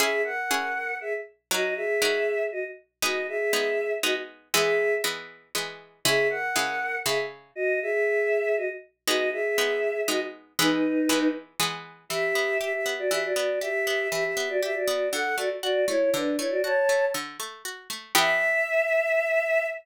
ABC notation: X:1
M:3/4
L:1/16
Q:1/4=119
K:C#dor
V:1 name="Choir Aahs"
[Ge]2 [Af]6 [Ge] z3 | [Fd]2 [Ge]6 [Fd] z3 | [Fd]2 [Ge]6 [Fd] z3 | [Ge]4 z8 |
[Ge]2 [Af]6 [Ge] z3 | [Fd]2 [Ge]6 [Fd] z3 | [Fd]2 [Ge]6 [Fd] z3 | [DB]6 z6 |
[K:Edor] [Ge]4 [Ge] [Ge]2 [Fd] [Ge] [Fd]3 | [Ge]4 [Ge] [Ge]2 [Fd] [Ge] [Fd]3 | [Af]2 [Fd] z [Fd]2 [Ec]2 [DB]2 [Ec] [Fd] | [ca]4 z8 |
e12 |]
V:2 name="Harpsichord"
[CEG]4 [CEG]8 | [F,DA]4 [F,DA]8 | [G,B,D]4 [G,B,D]4 [G,B,D]4 | [E,G,B,]4 [E,G,B,]4 [E,G,B,]4 |
[C,G,E]4 [C,G,E]4 [C,G,E]4 | z12 | [G,B,D]4 [G,B,D]4 [G,B,D]4 | [E,G,B,]4 [E,G,B,]4 [E,G,B,]4 |
[K:Edor] E,2 B,2 G2 B,2 E,2 B,2 | G2 B,2 E,2 B,2 G2 B,2 | D,2 A,2 F2 A,2 D,2 A,2 | F2 A,2 D,2 A,2 F2 A,2 |
[E,B,G]12 |]